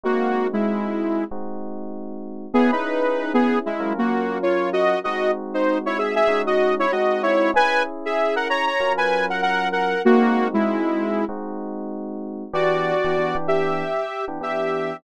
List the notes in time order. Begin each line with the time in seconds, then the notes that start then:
0.04 G#3 A#3 C4 D#4 F#4
0.53 G#3 E4
1.31 G#3 C4 D#4 F#4
2.54 B3 C#4 E4 G#4
2.72 D#4 B4
3.34 B3 G#4
3.66 G#3 E4
3.80 F#3 C#4 F4 A#4
3.98 A#3 F#4
4.43 F4 C#5
4.73 F#4 D#5
5.04 G#3 C4 D#4 F#4 D#5
5.54 D#4 C5
5.86 E4 C#5
5.98 G#4 E5
6.15 G#4 E5
6.28 G#3 C#4 D#4 F#4
6.47 F#4 D#5
6.79 E4 C#5
6.92 G#3 C4 D#4 F#4 D#5
7.23 E4 C#5
7.54 C#4 E4 G#4 B4 G#5
8.05 G#4 E5
8.36 A#4 F#5
8.49 C#5 A#5
8.66 C#5 A#5
8.80 F#3 C#4 F4 A#4
8.97 B4 G#5
9.30 A#4 F#5
9.42 A#4 F#5
9.72 A#4 F#5
10.05 G#3 A#3 C4 D#4 F#4
10.54 G#3 E4
11.29 G#3 C4 D#4 F#4
12.53 E3 B3 D4 F#4 G4 D5
13.05 E3 B3 D4 G4
13.18 E3 B3 D4 G4
13.35 E3 B3 D4 G4
13.48 G4 E5
14.28 E3 B3 D4 G4
14.41 E3 B3 D4 G4 E5